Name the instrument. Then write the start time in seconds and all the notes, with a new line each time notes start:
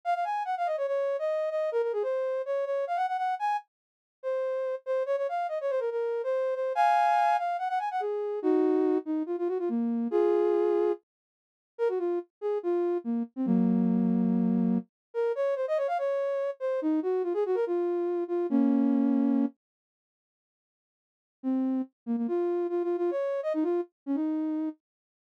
ocarina
0.05 F5
0.14 F5
0.24 G#5
0.45 F#5
0.57 F5
0.66 D#5
0.77 C#5
0.87 C#5
1.19 D#5
1.50 D#5
1.72 A#4
1.82 A#4
1.93 G#4
2.03 C5
2.46 C#5
2.65 C#5
2.87 F5
2.96 F#5
3.08 F#5
3.17 F#5
3.39 G#5
4.23 C5
4.86 C5
5.06 C#5
5.17 C#5
5.29 F5
5.49 D#5
5.61 C#5
5.70 C5
5.80 A#4
5.91 A#4
6.24 C5
6.55 C5
6.75 F5 G#5
7.38 F5
7.58 F#5
7.69 F#5
7.79 G#5
7.91 F#5
8.00 G#4
8.42 D#4 F#4
9.05 D#4
9.26 F4
9.38 F4
9.48 F#4
9.59 F4
9.69 A#3
10.11 F4 G#4
11.78 A#4
11.89 F#4
11.99 F4
12.41 G#4
12.63 F4
13.04 A#3
13.36 C4
13.46 F#3 A#3
15.14 A#4
15.35 C#5
15.56 C5
15.68 D#5
15.77 C#5
15.88 F5
15.98 C#5
16.60 C5
16.82 D#4
17.03 F#4
17.23 F4
17.34 G#4
17.46 F#4
17.55 A#4
17.67 F4
18.28 F4
18.50 A#3 C#4
21.43 C4
22.06 A#3
22.17 A#3
22.28 F4
22.69 F4
22.83 F4
22.97 F4
23.11 C#5
23.43 D#5
23.54 D#4
23.63 F4
24.06 C#4
24.15 D#4